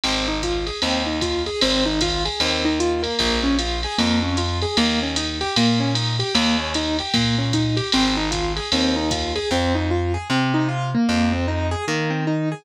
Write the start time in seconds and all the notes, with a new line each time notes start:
0.04 G#1 C4, ride
0.28 D#4
0.43 F4, kick, hi-hat pedal, ride
0.67 G#4, ride
0.82 D#2 C4, ride
1.06 D#4
1.21 F4, kick, hi-hat pedal, ride
1.46 G#4, ride
1.61 G#1 C4, ride
1.86 D#4
2.01 F4, kick, hi-hat pedal, ride
2.25 G#4, ride
2.40 D#2 C4, ride
2.65 D#4
2.80 F4, hi-hat pedal
3.03 A#3, ride
3.19 A#1, kick, ride
3.43 C#4
3.59 F4, hi-hat pedal, ride
3.83 G#4, ride
3.98 F2 A#3, ride
4.23 C#4
4.37 F4, hi-hat pedal, ride
4.62 G#4, ride
4.77 D#2 A#3, ride
5.03 C#4
5.16 D#4, hi-hat pedal, ride
5.41 G4, ride
5.56 A#2 A#3, ride
5.80 C#4
5.95 D#4, hi-hat pedal, ride
6.19 G4, ride
6.35 D#2 A#3, ride
6.59 C#4
6.74 D#4, hi-hat pedal, ride
6.99 G4, ride
7.14 A#2 A#3, kick, ride
7.38 C#4
7.53 D#4, kick, hi-hat pedal, ride
7.77 G4, ride
7.92 G#1 C4, ride
8.17 D#4
8.31 F4, kick, hi-hat pedal, ride
8.56 G#4, ride
8.72 D#2 C4, ride
8.96 D#4
9.11 F4, kick, hi-hat pedal, ride
9.36 G#4, ride
9.51 F2 C4
9.75 D#4
9.91 F4
10.14 G#4
10.30 C3 C4
10.54 D#4
10.69 F4
10.95 A#3
11.09 F2
11.32 C4
11.48 D#4
11.71 G#4
11.88 D#3 A#3
12.10 C4
12.27 D#4
12.52 G#4